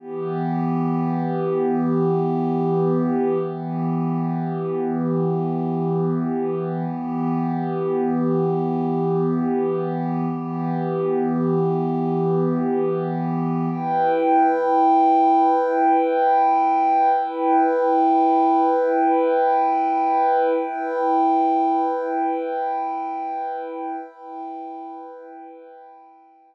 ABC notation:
X:1
M:4/4
L:1/8
Q:1/4=70
K:Em
V:1 name="Pad 2 (warm)"
[E,B,G]8 | [E,B,G]8 | [E,B,G]8 | [E,B,G]8 |
[EBg]8 | [EBg]8 | [EBg]8 | [EBg]8 |]